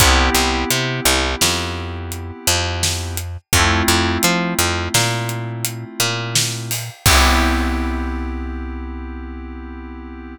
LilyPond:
<<
  \new Staff \with { instrumentName = "Electric Piano 2" } { \time 5/4 \key c \major \tempo 4 = 85 <b c' e' g'>1~ <b c' e' g'>4 | <a c' e' f'>1~ <a c' e' f'>4 | <b c' e' g'>1~ <b c' e' g'>4 | }
  \new Staff \with { instrumentName = "Electric Bass (finger)" } { \clef bass \time 5/4 \key c \major c,8 c,8 c8 c,8 f,4. f,4. | f,8 f,8 f8 f,8 ais,4. ais,4. | c,1~ c,4 | }
  \new DrumStaff \with { instrumentName = "Drums" } \drummode { \time 5/4 <hh bd>8 hh8 hh8 hh8 sn4 hh8 hh8 sn8 hh8 | <hh bd>8 hh8 hh8 hh8 sn8 hh8 hh8 hh8 sn8 hho8 | <cymc bd>4 r4 r4 r4 r4 | }
>>